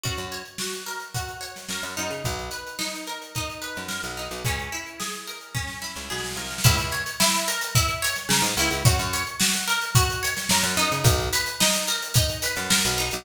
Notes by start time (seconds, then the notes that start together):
0.03 F#2 F#4, kick, closed hi-hat
0.17 F#2, closed hi-hat
0.32 C#5, closed hi-hat
0.45 closed hi-hat
0.58 F#4, snare
0.73 closed hi-hat
0.86 A#4, snare, closed hi-hat
1.00 closed hi-hat
1.14 F#4, kick, closed hi-hat
1.28 closed hi-hat
1.41 C#5, closed hi-hat
1.56 snare, closed hi-hat
1.69 F#2 A#4, snare
1.83 F#2, snare, closed hi-hat
1.96 F#2 D#4, snare, closed hi-hat
2.10 C#3, closed hi-hat
2.24 B1, kick, closed hi-hat
2.39 closed hi-hat
2.51 B4, closed hi-hat
2.67 closed hi-hat
2.79 D#4, snare
2.94 snare, closed hi-hat
3.07 A#4, closed hi-hat
3.22 closed hi-hat
3.35 D#4, kick, closed hi-hat
3.50 closed hi-hat
3.62 B4, closed hi-hat
3.75 F#2, snare, closed hi-hat
3.88 A#4, snare
4.03 B1, closed hi-hat
4.17 D#4, snare, closed hi-hat
4.31 B1, closed hi-hat
4.44 C#2 C#4, kick, closed hi-hat
4.59 closed hi-hat
4.72 E4, closed hi-hat
4.86 closed hi-hat
5.00 G#4, snare
5.13 closed hi-hat
5.27 A#4, closed hi-hat
5.41 closed hi-hat
5.54 C#4, kick, snare
5.67 snare
5.82 E4, snare
5.96 C#2, snare
6.10 B1 G#4, snare
6.18 snare
6.24 snare
6.31 snare
6.36 C2 A#4, snare
6.45 snare
6.50 snare
6.58 snare
6.64 C#2 E4, kick, closed hi-hat
6.78 C#2, closed hi-hat
6.91 C#5, closed hi-hat
7.06 closed hi-hat
7.20 E4, snare
7.33 snare, closed hi-hat
7.48 A#4, closed hi-hat
7.61 closed hi-hat
7.75 E4, kick, closed hi-hat
7.88 closed hi-hat
8.02 C#5, closed hi-hat
8.16 snare, closed hi-hat
8.29 C#3 A#4, snare
8.42 G#2, closed hi-hat
8.57 C#2 E4, closed hi-hat
8.70 C#2, closed hi-hat
8.85 F#2 F#4, kick, closed hi-hat
8.99 F#2, closed hi-hat
9.13 C#5, closed hi-hat
9.26 closed hi-hat
9.40 F#4, snare
9.54 closed hi-hat
9.67 A#4, snare, closed hi-hat
9.81 closed hi-hat
9.95 F#4, kick, closed hi-hat
10.10 closed hi-hat
10.23 C#5, closed hi-hat
10.36 snare, closed hi-hat
10.49 F#2 A#4, snare
10.63 F#2, snare, closed hi-hat
10.77 F#2 D#4, snare, closed hi-hat
10.92 C#3, closed hi-hat
11.04 B1, kick, closed hi-hat
11.20 closed hi-hat
11.33 B4, closed hi-hat
11.46 closed hi-hat
11.60 D#4, snare
11.73 snare, closed hi-hat
11.87 A#4, closed hi-hat
12.02 closed hi-hat
12.14 D#4, kick, closed hi-hat
12.29 closed hi-hat
12.42 B4, closed hi-hat
12.56 F#2, snare, closed hi-hat
12.70 A#4, snare
12.85 B1, closed hi-hat
12.98 D#4, snare, closed hi-hat
13.11 B1, closed hi-hat